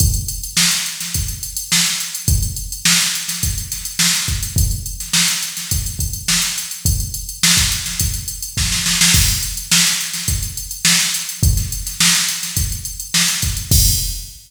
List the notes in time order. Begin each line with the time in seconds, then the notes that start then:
0.00 kick, closed hi-hat
0.14 closed hi-hat
0.28 closed hi-hat
0.43 closed hi-hat
0.57 snare
0.71 snare, closed hi-hat
0.86 closed hi-hat
1.00 snare, closed hi-hat
1.14 kick, closed hi-hat
1.28 closed hi-hat
1.43 closed hi-hat
1.57 closed hi-hat
1.72 snare
1.86 closed hi-hat
2.00 closed hi-hat
2.15 closed hi-hat
2.28 kick, closed hi-hat
2.43 closed hi-hat
2.56 closed hi-hat
2.72 closed hi-hat
2.85 snare
3.00 closed hi-hat
3.15 closed hi-hat
3.28 snare, closed hi-hat
3.43 kick, closed hi-hat
3.58 closed hi-hat
3.72 snare, closed hi-hat
3.85 closed hi-hat
3.99 snare
4.14 snare, closed hi-hat
4.28 kick, closed hi-hat
4.43 closed hi-hat
4.56 kick, closed hi-hat
4.71 closed hi-hat
4.86 closed hi-hat
5.00 snare, closed hi-hat
5.13 snare
5.28 closed hi-hat
5.43 closed hi-hat
5.57 snare, closed hi-hat
5.71 kick, closed hi-hat
5.86 closed hi-hat
5.99 kick, closed hi-hat
6.13 closed hi-hat
6.28 snare
6.42 closed hi-hat
6.58 closed hi-hat
6.71 closed hi-hat
6.85 kick, closed hi-hat
7.00 closed hi-hat
7.14 closed hi-hat
7.29 closed hi-hat
7.43 snare
7.57 kick, closed hi-hat
7.72 closed hi-hat
7.86 snare, closed hi-hat
8.00 kick, closed hi-hat
8.14 closed hi-hat
8.28 closed hi-hat
8.43 closed hi-hat
8.57 kick, snare
8.72 snare
8.86 snare
9.01 snare
9.14 kick, crash
9.28 closed hi-hat
9.43 closed hi-hat
9.57 closed hi-hat
9.72 snare
9.87 closed hi-hat
10.01 closed hi-hat
10.13 snare, closed hi-hat
10.28 kick, closed hi-hat
10.43 closed hi-hat
10.57 closed hi-hat
10.71 closed hi-hat
10.85 snare
11.00 closed hi-hat
11.14 closed hi-hat
11.29 closed hi-hat
11.43 kick, closed hi-hat
11.57 snare, closed hi-hat
11.72 closed hi-hat
11.86 snare, closed hi-hat
12.00 snare
12.15 closed hi-hat
12.28 closed hi-hat
12.43 snare, closed hi-hat
12.57 kick, closed hi-hat
12.72 closed hi-hat
12.85 closed hi-hat
13.00 closed hi-hat
13.14 snare
13.28 closed hi-hat
13.42 kick, closed hi-hat
13.57 closed hi-hat
13.71 kick, crash